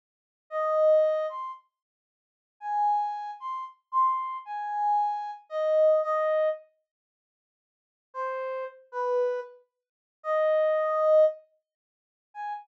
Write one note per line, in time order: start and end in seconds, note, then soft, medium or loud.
0.50 1.26 D#5 medium
1.29 1.51 C6 medium
2.60 3.31 G#5 medium
3.40 3.64 C6 medium
3.92 4.37 C6 loud
4.45 5.31 G#5 loud
5.49 6.01 D#5 medium
6.03 6.49 D#5 loud
8.14 8.64 C5 medium
8.92 9.40 B4 medium
10.23 11.24 D#5 loud
12.34 12.53 G#5 loud